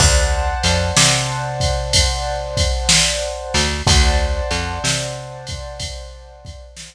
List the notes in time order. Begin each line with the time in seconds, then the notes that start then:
0.00 D2 C5 D5 F#5 A5, kick, crash
0.63 F2, ride
0.97 C3, snare
1.60 kick, ride
1.93 kick, ride
2.57 kick, ride
2.89 snare
3.54 D2, snare, ride
3.87 D2 C5 D5 F#5 A5, kick, ride
4.51 F2, ride
4.84 C3, snare
5.47 kick, ride
5.80 kick, ride
6.45 kick, ride
6.77 snare